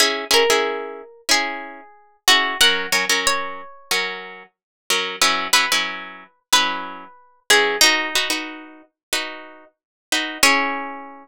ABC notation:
X:1
M:4/4
L:1/16
Q:1/4=92
K:C#dor
V:1 name="Orchestral Harp"
z2 A6 G6 F2 | f4 c6 z6 | z2 B6 B6 G2 | D6 z10 |
C16 |]
V:2 name="Orchestral Harp"
[CEG]2 [CEG] [CEG]5 [CE]6 [CEG]2 | [F,CA]2 [F,CA] [F,CA]5 [F,CA]6 [F,CA]2 | [F,CEB]2 [F,CE] [F,CEB]5 [F,CE]6 [F,CEB]2 | [FB]2 [DFB] [DFB]5 [DFB]6 [DFB]2 |
[EG]16 |]